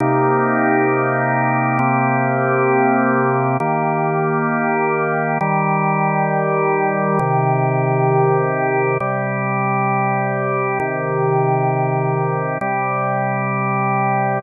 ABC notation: X:1
M:3/4
L:1/8
Q:1/4=100
K:Cm
V:1 name="Drawbar Organ"
[C,B,EG]6 | [C,B,CG]6 | [E,B,G]6 | [E,G,G]6 |
[C,E,G]6 | [C,G,G]6 | [C,E,G]6 | [C,G,G]6 |]